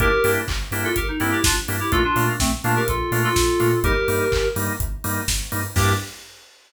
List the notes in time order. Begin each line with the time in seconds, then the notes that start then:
0.00 G1 A#3 D4 E4 G4 A#4, kick, closed hi-hat
0.24 G2 A#3 D4 E4 G4, open hi-hat
0.48 G1, kick, clap
0.71 G2 A#3 D4 E4 G4, open hi-hat
0.84 F4 A4
0.96 G1 G4 A#4, kick, closed hi-hat
1.08 D#4
1.20 G2 A#3 C4 D4 E4 G4, open hi-hat
1.32 E4 G4
1.44 G1 D4 F4, kick, snare
1.68 G2 A#3 D4 E4 G4, open hi-hat
1.80 E4 G4
1.92 A#1 A3 A#3 D4 F4 A4, kick, closed hi-hat
2.04 D4 F4
2.16 A#2 A3 A#3 D4 F4, open hi-hat
2.40 A#1 A3 C4, kick, snare
2.64 A#2 A3 A#3 D4 F4, open hi-hat
2.76 G4 A#4
2.88 A#1 F4 A4, kick, closed hi-hat
3.11 A#2 A3 A#3 D4 F4, open hi-hat
3.24 F4 A4
3.36 A#1, kick, snare
3.60 A#2 A3 A#3 D4 F4, open hi-hat
3.83 G1 G3 A#3 D#4 G4 A#4, kick, closed hi-hat
4.08 G2 G3 A#3 D#4, open hi-hat
4.32 G1, kick, clap
4.56 G2 G3 A#3 D#4, open hi-hat
4.80 G1, kick, closed hi-hat
5.04 G2 G3 A#3 D#4, open hi-hat
5.28 G1, kick, snare
5.52 G2 G3 A#3 D#4, open hi-hat
5.76 G2 A#3 D4 E4 G4, kick, crash